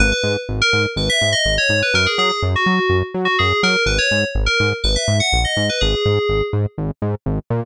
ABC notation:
X:1
M:4/4
L:1/16
Q:1/4=124
K:G#m
V:1 name="Electric Piano 2"
B B2 z2 A2 z B e2 d2 c2 B | A G G G z F4 z2 F G2 A2 | B c2 z2 A2 z B e2 f2 d2 B | G6 z10 |]
V:2 name="Synth Bass 1" clef=bass
G,,,2 G,,2 G,,,2 G,,2 G,,,2 G,,2 G,,,2 G,,2 | F,,2 F,2 F,,2 F,2 F,,2 F,2 F,,2 F,2 | G,,,2 G,,2 G,,,2 G,,2 G,,,2 G,,2 A,,,2 G,,2 | G,,,2 G,,2 G,,,2 G,,2 G,,,2 G,,2 G,,,2 A,,2 |]